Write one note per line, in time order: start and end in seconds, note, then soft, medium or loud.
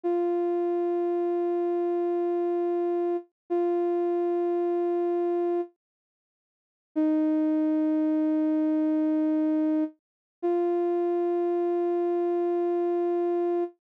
0.04 3.17 F4 medium
3.50 5.61 F4 medium
6.96 9.84 D#4 medium
10.43 13.64 F4 medium